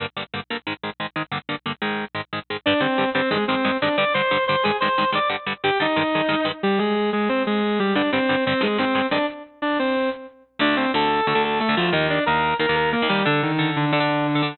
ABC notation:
X:1
M:4/4
L:1/16
Q:1/4=181
K:Gphr
V:1 name="Distortion Guitar"
z16 | z16 | [Dd]2 [Cc]4 [Cc]2 [A,A]2 [Cc]4 [Dd]2 | [dd']2 [cc']4 [cc']2 [Aa]2 [cc']4 [dd']2 |
z4 [Gg]2 [Ee]8 z2 | [G,G]2 [A,A]4 [A,A]2 [Cc]2 [A,A]4 [G,G]2 | [Dd]2 [Cc]4 [Cc]2 [A,A]2 [Cc]4 [Dd]2 | z4 [Dd]2 [Cc]4 z6 |
[K:Dphr] [Dd]2 [Cc]2 [Aa]4 [Aa]2 [Aa]2 [A,A]2 [F,F]2 | [Ee]2 [Dd]2 [Bb]4 [Bb]2 [Bb]2 [B,B]2 [G,G]2 | [D,D]2 [E,E]4 [D,D]2 [D,D]8 |]
V:2 name="Overdriven Guitar"
[G,,D,B,]2 [G,,D,B,]2 [G,,D,B,]2 [G,,D,B,]2 [A,,E,A,]2 [A,,E,A,]2 [A,,E,A,]2 [A,,E,A,]2 | [G,,D,B,]2 [G,,D,B,]2 [G,,D,B,]2 [A,,E,A,]4 [A,,E,A,]2 [A,,E,A,]2 [A,,E,A,]2 | [G,,D,G,]2 [G,,D,G,]2 [G,,D,G,]2 [G,,D,G,]2 [G,,E,A,]2 [G,,E,A,]2 [G,,E,A,]2 [G,,E,A,]2 | [G,,D,G,]2 [G,,D,G,]2 [G,,D,G,]2 [G,,D,G,]2 [G,,E,A,]2 [G,,E,A,]2 [G,,E,A,]2 [G,,E,A,]2 |
[G,,D,G,]2 [G,,D,G,]2 [G,,D,G,]2 [G,,D,G,]2 [G,,E,A,]2 [G,,E,A,]2 [G,,E,A,]2 [G,,E,A,]2 | z16 | [G,,D,G,]2 [G,,D,G,]2 [G,,D,G,]2 [G,,D,G,]2 [G,,E,A,]2 [G,,E,A,]2 [G,,E,A,]2 [G,,E,A,]2 | z16 |
[K:Dphr] [D,,D,A,]4 [D,,D,A,]4 [D,,D,A,] [D,,D,A,]4 [D,,D,A,] [D,,D,A,]2 | [E,,E,B,]4 [E,,E,B,]4 [E,,E,B,] [E,,E,B,]4 [E,,E,B,] [E,,E,B,]2 | [D,DA]4 [D,DA]4 [D,DA] [D,DA]4 [D,DA] [D,DA]2 |]